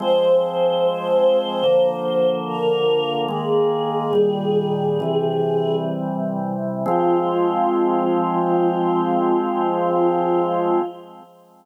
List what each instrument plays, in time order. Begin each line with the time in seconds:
0.00 drawbar organ F3 G#3 C4, choir aahs C5
1.64 drawbar organ D3 F3 A#3
2.47 choir aahs A#4
3.28 drawbar organ D#3 G#3 A#3, choir aahs G#4
4.13 drawbar organ A#2 D#3 G3
5.00 drawbar organ C3 E3 G3
6.86 drawbar organ F3 G#3 C4, choir aahs F4